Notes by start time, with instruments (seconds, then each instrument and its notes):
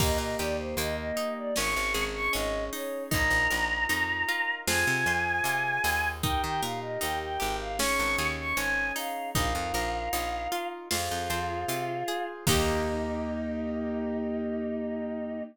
0.00 electric bass (finger) D#2, acoustic guitar (steel) A#3, acoustic grand piano A#3 D#4 G4, choir aahs D#5, kick, crash
0.18 electric bass (finger) A#2, choir aahs D#5
0.38 electric bass (finger) D#2, acoustic guitar (steel) G4, choir aahs D5, closed hi-hat
0.58 choir aahs C5
0.77 electric bass (finger) D#2, acoustic guitar (steel) A#3, choir aahs D#5, closed hi-hat
0.97 choir aahs D#5
1.17 acoustic guitar (steel) D#4, closed hi-hat
1.37 choir aahs D5
1.56 electric bass (finger) G#1, acoustic grand piano C#4 D#4 G#4, acoustic guitar (steel) C#4, choir aahs C#6, snare
1.76 electric bass (finger) G#1
1.94 electric bass (finger) G#1, acoustic guitar (steel) G#4, closed hi-hat
2.14 choir aahs C#6
2.32 electric bass (finger) G#1, acoustic guitar (steel) C#4, choir aahs D#5, closed hi-hat
2.71 acoustic guitar (steel) D#4, choir aahs C#5, open hi-hat
3.10 electric bass (finger) A#1, acoustic grand piano D#4 F4 A#4, acoustic guitar (steel) D#4, choir aahs A#5, kick, closed hi-hat
3.31 electric bass (finger) A#1
3.50 electric bass (finger) A#1, acoustic guitar (steel) A#4, closed hi-hat
3.89 electric bass (finger) F2, acoustic guitar (steel) D#4, closed hi-hat
4.29 acoustic guitar (steel) F4, closed hi-hat
4.67 electric bass (finger) F2, acoustic guitar (steel) F4, acoustic grand piano F4 G#4 C5, choir aahs G#5, snare
4.87 electric bass (finger) C3
5.06 electric bass (finger) F2, acoustic guitar (steel) C5, closed hi-hat
5.44 electric bass (finger) C3, acoustic guitar (steel) F4, closed hi-hat
5.84 electric bass (finger) D#2, acoustic guitar (steel) G#4, open hi-hat
6.23 acoustic guitar (steel) D#4, acoustic grand piano D#4 G4 A#4, choir aahs G5, kick, closed hi-hat
6.43 electric bass (finger) D#3, choir aahs G5
6.61 electric bass (finger) A#2, acoustic guitar (steel) A#4, choir aahs F5, closed hi-hat
6.81 choir aahs D#5
7.00 electric bass (finger) D#2, acoustic guitar (steel) D#4, choir aahs G5, closed hi-hat
7.22 choir aahs G5
7.40 electric bass (finger) G#1, acoustic guitar (steel) G4, closed hi-hat
7.60 choir aahs F5
7.79 acoustic grand piano C#4 D#4 G#4, acoustic guitar (steel) C#4, choir aahs C#6, snare
7.99 electric bass (finger) G#1
8.18 electric bass (finger) D#2, acoustic guitar (steel) G#4, closed hi-hat
8.39 choir aahs C#6
8.57 electric bass (finger) G#1, acoustic guitar (steel) C#4, choir aahs G#5, closed hi-hat
8.96 acoustic guitar (steel) D#4, choir aahs F5, open hi-hat
9.35 electric bass (finger) A#1, acoustic guitar (steel) D#4, acoustic grand piano D#4 F4 A#4, choir aahs F5, kick, closed hi-hat
9.55 electric bass (finger) F2
9.74 electric bass (finger) A#1, acoustic guitar (steel) A#4, closed hi-hat
10.13 electric bass (finger) A#1, acoustic guitar (steel) D#4, closed hi-hat
10.52 acoustic guitar (steel) F4, closed hi-hat
10.90 electric bass (finger) F2, choir aahs F4, acoustic guitar (steel) F4, acoustic grand piano F4 G#4 C5, snare
11.11 electric bass (finger) F2
11.30 electric bass (finger) F2, acoustic guitar (steel) C5, closed hi-hat
11.68 electric bass (finger) C3, acoustic guitar (steel) F4, closed hi-hat
12.08 acoustic guitar (steel) G#4, closed hi-hat
12.47 electric bass (finger) D#2, acoustic guitar (steel) A#3 D#4 G4, acoustic grand piano A#3 D#4 G4, choir aahs D#4, kick, crash